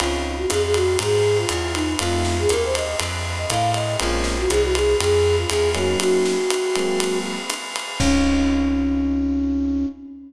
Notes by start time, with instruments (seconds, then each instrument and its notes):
0.00 electric bass (finger) C#2, electric piano 1 C4 C#4 D#4 F4, flute F4, ride
0.37 flute F#4
0.50 electric bass (finger) F2, flute G#4, snare, hi-hat pedal, ride
0.63 flute G#4
0.74 flute F#4, ride
0.99 electric bass (finger) G#2, flute G#4, ride
1.38 flute F4
1.49 electric bass (finger) E2, flute F4, hi-hat pedal, ride
1.74 flute D#4, ride
1.99 electric bass (finger) F2, electric piano 1 A3 C4 D#4 F4, flute F4, ride
2.25 snare
2.39 flute G#4
2.49 electric bass (finger) D#2, flute A#4, hi-hat pedal, ride
2.64 flute C5
2.75 flute D#5, ride
3.00 electric bass (finger) F2, ride
3.38 flute D#5
3.50 electric bass (finger) A2, flute F5, kick, hi-hat pedal, ride
3.74 flute D#5, ride
4.00 electric bass (finger) A#1, electric piano 1 G#3 A#3 C4 C#4, flute F4, ride
4.24 snare
4.38 flute F#4
4.49 electric bass (finger) C2, flute G#4, hi-hat pedal, ride
4.63 flute F#4
4.75 flute G#4, ride
5.00 electric bass (finger) F2, flute G#4, ride
5.38 flute F4
5.49 electric bass (finger) E2, flute G#4, hi-hat pedal, ride
5.75 electric piano 1 F#3 A#3 C#4 D#4, flute F#4, ride
6.00 flute F#4, ride
6.26 snare
6.50 hi-hat pedal, ride
6.76 electric piano 1 F#3 G#3 A#3 C4, ride
7.00 ride
7.50 hi-hat pedal, ride
7.76 ride
8.00 electric bass (finger) C#2, electric piano 1 C4 C#4 D#4 F4, flute C#4, kick, crash